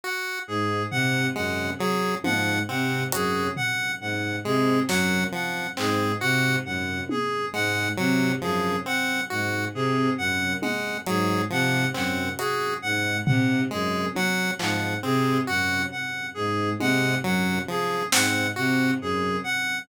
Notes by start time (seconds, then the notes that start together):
0.04 F#4 F#5
0.47 G#2 G#4
0.91 C3 F#5, floor tom
1.35 F#2 G#3 F#5
1.78 F#3 G#4
2.24 G#2 F3 F#5, high tom
2.68 C3 C4 F#5
3.12 F#2 F#4 G#4, closed hi-hat
3.56 F#5, floor tom
4.00 G#2 F#5
4.44 C3 G#3 G#4
4.88 F#2 F#3 F#5, snare
5.32 F3 F#5
5.77 G#2 C4 G#4, clap
6.20 C3 F#4 F#5
6.65 F#2 F#5
7.09 G#4, high tom
7.53 G#2 G#3 F#5
7.97 C3 F#3 F#5
8.42 F#2 F3 G#4
8.86 C4 F#5
9.30 G#2 F#4 F#5
9.74 C3 G#4
10.18 F#2 F#5
10.62 G#3 F#5, high tom
11.06 G#2 F#3 G#4, closed hi-hat
11.50 C3 F3 F#5
11.94 F#2 C4 F#5, clap
12.38 F#4 G#4, closed hi-hat
12.82 G#2 F#5
13.26 C3 F#5, floor tom
13.71 F#2 G#3 G#4
14.15 F#3 F#5, high tom
14.59 G#2 F3 F#5, clap
15.03 C3 C4 G#4
15.47 F#2 F#4 F#5
15.91 F#5
16.34 G#2 G#4
16.80 C3 G#3 F#5, high tom
17.24 F#2 F#3 F#5
17.68 F3 G#4
18.12 G#2 C4 F#5, snare
18.56 C3 F#4 F#5
19.01 F#2 G#4
19.44 F#5